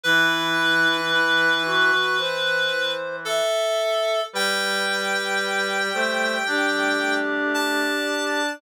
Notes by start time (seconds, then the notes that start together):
0.04 E3 E4 B4
1.12 E4
1.65 F#4
2.19 C5
3.25 A4 E5
4.33 G3 B4 G5
5.94 A3 C5
6.47 D4 G4
7.54 A5